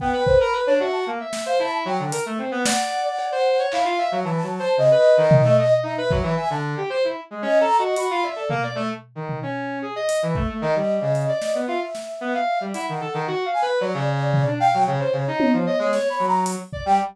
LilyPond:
<<
  \new Staff \with { instrumentName = "Flute" } { \time 4/4 \tempo 4 = 113 g''8 c''16 b''8 cis''16 e''16 a''16 r8. f''16 a''16 r16 g''8 | r4 fis''2 f''4 | a''4 dis''2 e''4 | gis''16 a''16 r4. \tuplet 3/2 { dis''8 ais''8 dis''8 } b''8 d''8 |
r1 | dis''2 e''2 | fis''4 r8 gis''16 r16 d''4. g''8 | cis''4. cis''8 \tuplet 3/2 { cis''8 b''8 ais''8 } r8. g''16 | }
  \new Staff \with { instrumentName = "Brass Section" } { \time 4/4 b16 b'8 ais'16 b'16 d'16 fis'8 ais16 e''8 c''16 e'8 fis16 d16 | ais'16 a16 c'16 b16 d''8. d''8 c''8 cis''16 e'16 f'16 e''16 fis16 | \tuplet 3/2 { e8 fis8 c''8 } cis16 b'8 dis8 a16 dis''16 dis''16 dis'16 b'16 fis16 e16 | e''16 d8 g'16 c''16 e'16 r16 gis16 \tuplet 3/2 { cis'8 a'8 fis'8 } fis'16 f'16 e''16 a'16 |
ais16 d''16 a16 r8 dis8 cis'8. gis'16 dis''8 e16 a16 a16 | dis16 g8 cis8 d''8 b16 f'16 r8. b16 f''8 g16 | e'16 dis16 a'16 dis16 \tuplet 3/2 { fis'8 f''8 b'8 } fis16 cis4 d'16 f''16 fis16 | cis16 c''16 cis16 dis'8 f16 dis''16 gis16 cis''8 fis8. r16 d''16 g16 | }
  \new DrumStaff \with { instrumentName = "Drums" } \drummode { \time 4/4 bd8 bd8 r4 r8 sn8 r4 | hh4 sn4 cb4 hc4 | r4 r4 tomfh4 r8 bd8 | r4 r4 r4 hh4 |
tomfh4 r8 tomfh8 r4 hh8 bd8 | r4 hh8 sn8 r8 sn8 r4 | hh4 r4 cb4 tomfh4 | r8 cb8 tommh4 sn4 hh8 bd8 | }
>>